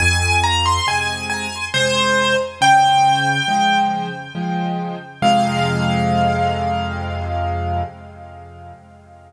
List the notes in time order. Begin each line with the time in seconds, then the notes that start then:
0.00 F2 G#5
0.43 A#5
0.66 C6
0.87 C3 G#3 G#5
1.30 G#5
1.74 C3 G#3 C5
2.61 C#3 G5
3.48 F3 G#3
4.35 F3 G#3
5.22 F2 C3 G#3 F5